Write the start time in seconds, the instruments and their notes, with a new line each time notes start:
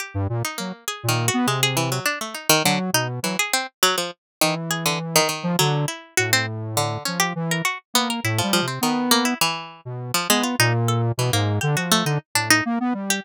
0.00 pizzicato strings G4
0.14 lead 1 (square) G2
0.29 lead 1 (square) A#2
0.45 pizzicato strings D#4
0.58 lead 1 (square) F#3, pizzicato strings A#3
0.88 pizzicato strings G#4
1.03 lead 1 (square) A#2
1.09 pizzicato strings D#3
1.28 pizzicato strings F#4
1.34 lead 1 (square) B3
1.47 lead 1 (square) C3, pizzicato strings G#3
1.63 pizzicato strings G#4
1.77 pizzicato strings E3
1.92 pizzicato strings F#3
2.06 pizzicato strings D4
2.21 pizzicato strings A3
2.35 pizzicato strings D#4
2.49 pizzicato strings D#3
2.64 pizzicato strings D3, lead 1 (square) F#3
2.93 lead 1 (square) B2, pizzicato strings D#4
3.23 pizzicato strings E3, lead 1 (square) F#3
3.39 pizzicato strings G#4
3.53 pizzicato strings C4
3.83 pizzicato strings F#3
3.98 pizzicato strings F3
4.41 pizzicato strings D#3, lead 1 (square) E3
4.71 pizzicato strings G#4
4.86 pizzicato strings D3
5.16 pizzicato strings D#3
5.29 pizzicato strings D#3
5.43 lead 1 (square) F3
5.59 lead 1 (square) D3, pizzicato strings F#3
5.88 pizzicato strings E4
6.17 lead 1 (square) A2, pizzicato strings F#4
6.33 pizzicato strings C4
6.77 pizzicato strings D3
7.05 lead 1 (square) F3, pizzicato strings C#4
7.20 pizzicato strings G4
7.36 lead 1 (square) E3
7.51 pizzicato strings A#4
7.65 pizzicato strings F#4
7.94 lead 1 (square) A#3, pizzicato strings B3
8.10 pizzicato strings A#4
8.24 lead 1 (square) A2, pizzicato strings E4
8.38 pizzicato strings F3
8.43 lead 1 (square) G3
8.53 pizzicato strings F3
8.62 lead 1 (square) C3
8.68 pizzicato strings C4
8.81 pizzicato strings D#3, lead 1 (square) B3
9.11 pizzicato strings A#3
9.25 pizzicato strings E4
9.41 pizzicato strings E3
9.85 lead 1 (square) B2
10.14 pizzicato strings F3
10.29 pizzicato strings G#3, lead 1 (square) B3
10.44 pizzicato strings F4
10.59 lead 1 (square) A#2, pizzicato strings D#4
10.88 pizzicato strings A4
11.18 lead 1 (square) B2, pizzicato strings E3
11.33 lead 1 (square) G#2, pizzicato strings A#3
11.61 lead 1 (square) D3, pizzicato strings G4
11.77 lead 1 (square) F3, pizzicato strings F#4
11.92 pizzicato strings A3
12.05 lead 1 (square) D3, pizzicato strings D#4
12.35 lead 1 (square) A2, pizzicato strings D4
12.50 pizzicato strings D#4
12.65 lead 1 (square) A#3
12.80 lead 1 (square) B3
12.94 lead 1 (square) G3
13.10 pizzicato strings G4